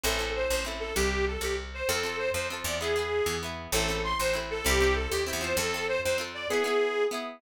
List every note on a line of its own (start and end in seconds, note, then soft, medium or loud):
0.04 0.46 A1 loud
0.04 0.18 C4 loud
0.04 0.18 E4 loud
0.04 0.30 A4 medium
0.04 0.18 A4 medium
0.19 0.61 C4 medium
0.19 0.61 E4 medium
0.19 0.61 A4 medium
0.35 0.48 C5 medium
0.49 0.92 A1 medium
0.49 0.63 C5 medium
0.65 0.93 C4 medium
0.65 0.93 E4 medium
0.65 0.93 A4 medium
0.80 0.95 A4 medium
0.96 1.37 C2 medium
0.96 1.25 G4 medium
1.27 1.42 A4 medium
1.41 1.82 C2 medium
1.41 1.56 G4 medium
1.74 1.89 C5 medium
1.88 2.30 F2 loud
1.88 2.03 C4 medium
1.88 2.03 F4 loud
1.88 2.17 A4 medium
1.88 2.03 A4 medium
2.03 2.46 C4 medium
2.03 2.46 F4 medium
2.03 2.46 A4 medium
2.18 2.30 C5 medium
2.33 2.63 F2 medium
2.33 2.47 C5 medium
2.50 2.79 C4 medium
2.50 2.79 F4 medium
2.50 2.79 A4 medium
2.64 3.21 E2 medium
2.64 2.78 D5 medium
2.80 2.95 B3 medium
2.80 2.95 E4 loud
2.80 3.35 G#4 medium
2.80 2.95 G#4 medium
2.96 3.38 B3 medium
2.96 3.38 E4 medium
2.96 3.38 G#4 medium
3.26 3.68 E2 medium
3.43 3.71 B3 medium
3.43 3.71 E4 medium
3.43 3.71 G#4 medium
3.72 4.14 A1 loud
3.72 3.88 C4 loud
3.72 3.88 E4 loud
3.72 3.98 A4 medium
3.77 3.88 A4 loud
3.88 4.31 C4 medium
3.88 4.31 E4 medium
3.88 4.31 A4 medium
4.04 4.17 C6 medium
4.19 4.61 A1 medium
4.19 4.35 C5 medium
4.33 4.62 C4 medium
4.33 4.62 E4 medium
4.33 4.62 A4 medium
4.51 4.65 A4 medium
4.65 5.07 C2 loud
4.65 4.79 C4 medium
4.65 4.79 E4 loud
4.65 4.95 G4 loud
4.65 4.79 G4 medium
4.81 5.23 C4 medium
4.81 5.23 E4 medium
4.81 5.23 G4 medium
4.95 5.10 A4 medium
5.11 5.32 D#2 medium
5.11 5.24 G4 medium
5.27 5.40 C4 medium
5.27 5.41 E4 loud
5.27 5.41 G4 medium
5.33 5.54 E2 medium
5.41 5.70 C4 loud
5.41 5.70 F4 medium
5.41 5.70 A4 loud
5.41 5.56 C5 medium
5.57 5.98 F2 loud
5.57 5.86 A4 loud
5.74 6.17 C4 medium
5.74 6.17 F4 medium
5.74 6.17 A4 medium
5.88 6.01 C5 medium
6.04 6.47 F2 medium
6.04 6.18 C5 medium
6.18 6.46 C4 loud
6.18 6.46 F4 medium
6.18 6.46 A4 loud
6.34 6.48 D5 medium
6.50 6.64 B3 loud
6.50 6.64 E4 medium
6.50 7.04 G#4 medium
6.50 6.64 G#4 loud
6.64 7.07 B3 medium
6.64 7.07 E4 medium
6.64 7.07 G#4 medium
7.11 7.39 B3 medium
7.11 7.39 E4 medium
7.11 7.39 G#4 medium